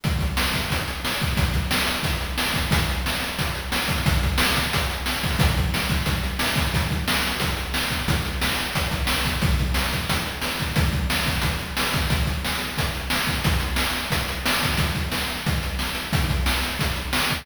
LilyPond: \new DrumStaff \drummode { \time 4/4 \tempo 4 = 179 <hh bd>8 <hh bd>8 sn8 <hh bd>8 <hh bd>8 hh8 sn8 <hh bd>8 | <hh bd>8 <hh bd>8 sn8 hh8 <hh bd>8 hh8 sn8 <hh bd>8 | <hh bd>8 hh8 sn8 hh8 <hh bd>8 hh8 sn8 <hh bd>8 | <hh bd>8 <hh bd>8 sn8 <hh bd>8 <hh bd>8 hh8 sn8 <hho bd>8 |
<hh bd>8 <hh bd>8 sn8 <hh bd>8 <hh bd>8 hh8 sn8 <hh bd>8 | <hh bd>8 <hh bd>8 sn8 hh8 <hh bd>8 hh8 sn8 <hh bd>8 | <hh bd>8 hh8 sn8 hh8 <hh bd>8 <hh bd>8 sn8 <hh bd>8 | <hh bd>8 <hh bd>8 sn8 <hh bd>8 <hh bd>8 hh8 sn8 <hh bd>8 |
<hh bd>8 <hh bd>8 sn8 <hh bd>8 <hh bd>8 hh8 sn8 <hh bd>8 | <hh bd>8 <hh bd>8 sn8 hh8 <hh bd>8 hh8 sn8 <hh bd>8 | <hh bd>8 hh8 sn8 hh8 <hh bd>8 hh8 sn8 <hh bd>8 | <hh bd>8 <hh bd>8 sn8 hh8 <hh bd>8 hh8 sn8 hh8 |
<hh bd>8 <hh bd>8 sn8 hh8 <hh bd>8 hh8 sn8 <hh bd>8 | }